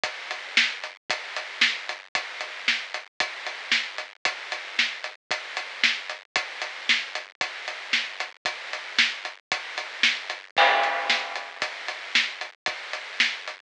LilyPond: \new DrumStaff \drummode { \time 6/8 \tempo 4. = 114 <hh bd>8. hh8. sn8. hh8. | <hh bd>8. hh8. sn8. hh8. | <hh bd>8. hh8. sn8. hh8. | <hh bd>8. hh8. sn8. hh8. |
<hh bd>8. hh8. sn8. hh8. | <hh bd>8. hh8. sn8. hh8. | <hh bd>8. hh8. sn8. hh8. | <hh bd>8. hh8. sn8. hh8. |
<hh bd>8. hh8. sn8. hh8. | <hh bd>8. hh8. sn8. hh8. | <cymc bd>8. hh8. sn8. hh8. | <hh bd>8. hh8. sn8. hh8. |
<hh bd>8. hh8. sn8. hh8. | }